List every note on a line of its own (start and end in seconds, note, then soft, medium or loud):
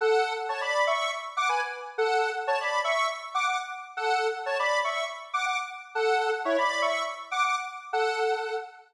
0.01 0.33 A4 loud
0.01 0.33 F#5 loud
0.49 0.61 C#5 medium
0.49 0.61 A5 medium
0.61 0.85 D5 medium
0.61 0.85 B5 medium
0.87 1.11 E5 medium
0.87 1.11 C#6 loud
1.37 1.48 F#5 loud
1.37 1.48 D6 loud
1.49 1.61 B4 medium
1.49 1.61 G#5 medium
1.98 2.30 A4 medium
1.98 2.30 F#5 loud
2.47 2.59 C#5 medium
2.47 2.59 A5 loud
2.61 2.81 D5 medium
2.61 2.81 B5 medium
2.84 3.08 E5 medium
2.84 3.08 C#6 loud
3.35 3.46 F#5 loud
3.35 3.46 D6 loud
3.46 3.58 F#5 medium
3.46 3.58 D6 medium
3.97 4.27 A4 medium
3.97 4.27 F#5 loud
4.46 4.58 C#5 medium
4.46 4.58 A5 medium
4.59 4.79 D5 medium
4.59 4.79 B5 loud
4.84 5.04 E5 medium
4.84 5.04 C#6 medium
5.33 5.45 F#5 medium
5.33 5.45 D6 loud
5.46 5.57 F#5 medium
5.46 5.57 D6 medium
5.95 6.30 A4 medium
5.95 6.30 F#5 loud
6.45 6.57 E4 medium
6.45 6.57 C#5 loud
6.58 6.81 D5 medium
6.58 6.81 B5 loud
6.82 7.03 E5 medium
6.82 7.03 C#6 medium
7.31 7.43 F#5 medium
7.31 7.43 D6 loud
7.44 7.55 F#5 medium
7.44 7.55 D6 loud
7.93 8.56 A4 loud
7.93 8.56 F#5 loud